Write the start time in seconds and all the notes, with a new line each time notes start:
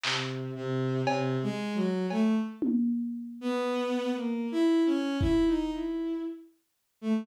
0.03 C3, clap
0.56 C3
1.06 C3, cowbell
1.43 G#3
1.75 F#3
2.10 A3, cowbell
2.62 high tom
3.41 B3
4.16 A#3
4.52 E4
4.86 C#4
5.21 E4, kick
5.47 D#4
5.72 E4
7.01 A3